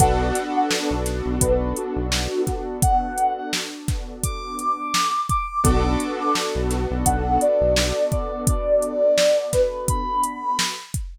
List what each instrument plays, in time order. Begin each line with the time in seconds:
0.00 synth bass 1 B1, acoustic grand piano B3 D4 F#4 A4, ocarina F#5, kick, closed hi-hat
0.35 snare, closed hi-hat
0.56 ocarina F#5
0.71 snare
0.91 synth bass 1 B1
1.06 snare, closed hi-hat
1.26 synth bass 1 B1
1.41 synth bass 1 B1, ocarina B4, kick, closed hi-hat
1.76 ocarina F#4, closed hi-hat
1.96 synth bass 1 B1
2.12 snare
2.47 ocarina F#4, kick, snare, closed hi-hat
2.82 ocarina F#5, kick, closed hi-hat
3.18 closed hi-hat
3.37 ocarina F#5
3.53 snare
3.88 kick, snare, closed hi-hat
4.24 ocarina D6, kick, closed hi-hat
4.59 ocarina D6, closed hi-hat
4.94 snare
5.29 ocarina D6, kick, closed hi-hat
5.64 synth bass 1 B1, acoustic grand piano B3 D4 F#4 A4, ocarina D6, kick, closed hi-hat
6.00 closed hi-hat
6.20 ocarina D6
6.35 snare
6.55 synth bass 1 B1
6.71 snare, closed hi-hat
6.91 synth bass 1 B1
7.05 synth bass 1 B1, ocarina F#5, kick, closed hi-hat
7.41 ocarina D5, closed hi-hat
7.61 synth bass 1 B1
7.76 snare
8.12 ocarina D5, kick, closed hi-hat
8.47 ocarina D5, kick, closed hi-hat
8.82 closed hi-hat
9.18 snare
9.53 ocarina B4, kick, snare, closed hi-hat
9.88 ocarina B5, kick, closed hi-hat
10.24 closed hi-hat
10.59 snare
10.94 kick, closed hi-hat